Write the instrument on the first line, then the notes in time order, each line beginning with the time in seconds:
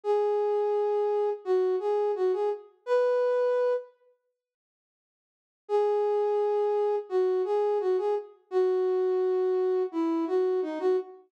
flute
0.04 G#4
1.45 F#4
1.80 G#4
2.15 F#4
2.33 G#4
2.86 B4
5.69 G#4
7.09 F#4
7.45 G#4
7.80 F#4
7.98 G#4
8.51 F#4
9.92 E4
10.27 F#4
10.62 D#4
10.80 F#4